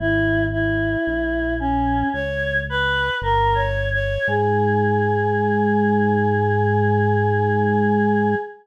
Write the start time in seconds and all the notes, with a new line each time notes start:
0.00 G#1 E4
0.52 E4
1.07 A#1
1.60 C#4
2.13 C#2 C#5
2.70 B4
3.22 G1 A#4
3.55 C#5
3.93 C#5
4.28 G#2 G#4